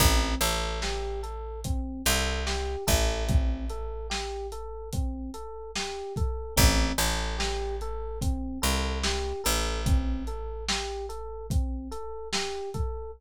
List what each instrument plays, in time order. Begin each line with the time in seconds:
0.00 electric bass (finger) A1, electric piano 1 C4, kick, closed hi-hat
0.41 electric bass (finger) A1, electric piano 1 A4, closed hi-hat
0.82 electric piano 1 G4, snare
1.23 electric piano 1 A4, closed hi-hat
1.64 electric piano 1 C4, kick, closed hi-hat
2.05 electric bass (finger) C2, electric piano 1 A4, closed hi-hat
2.47 electric piano 1 G4, snare
2.87 electric bass (finger) A1, electric piano 1 A4, kick, closed hi-hat
3.28 electric piano 1 C4, kick, closed hi-hat
3.70 electric piano 1 A4, closed hi-hat
4.10 electric piano 1 G4, snare
4.52 electric piano 1 A4, closed hi-hat
4.93 electric piano 1 C4, kick, closed hi-hat
5.34 electric piano 1 A4, closed hi-hat
5.76 electric piano 1 G4, snare
6.16 electric piano 1 A4, kick, closed hi-hat
6.57 electric bass (finger) A1, electric piano 1 C4, kick, closed hi-hat
6.98 electric bass (finger) A1, electric piano 1 A4, closed hi-hat
7.38 electric piano 1 G4, snare
7.81 electric piano 1 A4, closed hi-hat
8.21 electric piano 1 C4, kick, closed hi-hat
8.62 electric bass (finger) C2, electric piano 1 A4, closed hi-hat
9.03 electric piano 1 G4, snare
9.44 electric bass (finger) A1, electric piano 1 A4, closed hi-hat
9.86 electric piano 1 C4, kick, closed hi-hat
10.27 electric piano 1 A4, closed hi-hat
10.68 electric piano 1 G4, snare
11.09 electric piano 1 A4, closed hi-hat
11.50 electric piano 1 C4, kick, closed hi-hat
11.91 electric piano 1 A4, closed hi-hat
12.33 electric piano 1 G4, snare
12.74 electric piano 1 A4, kick, closed hi-hat